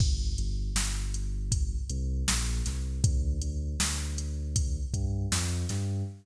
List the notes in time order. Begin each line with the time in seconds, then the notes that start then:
0.00 G1, kick, crash
0.38 G1, closed hi-hat
0.75 G1, snare
1.14 closed hi-hat
1.52 kick, closed hi-hat
1.90 C2, closed hi-hat
2.28 A#1, snare
2.66 C2, snare, closed hi-hat
3.03 D2, kick, closed hi-hat
3.41 D2, closed hi-hat
3.79 D2, snare
4.18 closed hi-hat
4.56 kick, closed hi-hat
4.93 G2, kick, closed hi-hat
5.32 F2, snare
5.69 G2, snare, closed hi-hat